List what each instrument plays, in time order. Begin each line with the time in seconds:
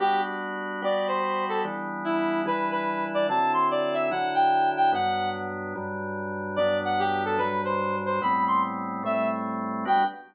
0.00 drawbar organ G3 B3 D4 F#4, brass section G4
0.82 drawbar organ G3 B3 F#4 G4, brass section D5
1.08 brass section C5
1.49 brass section A4
1.65 drawbar organ E3 G3 B3 D4
2.05 brass section E4
2.45 drawbar organ E3 G3 D4 E4, brass section B4
2.71 brass section B4
3.14 brass section D5
3.29 drawbar organ D3 F#3 C4 E4, brass section A5
3.54 brass section C6
3.71 brass section D5
3.94 brass section E5
4.11 drawbar organ D3 F#3 D4 E4, brass section F#5
4.35 brass section G5
4.77 brass section G5
4.92 drawbar organ G2 F#3 B3 D4, brass section F#5
5.76 drawbar organ G2 F#3 G3 D4
6.56 drawbar organ G2 F#3 B3 D4, brass section D5
6.85 brass section F#5
6.99 brass section G4
7.25 brass section A4
7.38 drawbar organ G2 F#3 G3 D4, brass section B4
7.65 brass section C5
8.06 brass section C5
8.21 drawbar organ A2 G3 B3 C4, brass section B5
8.48 brass section C6
9.03 drawbar organ A2 G3 A3 C4, brass section E5
9.85 drawbar organ G3 B3 D4 F#4, brass section G5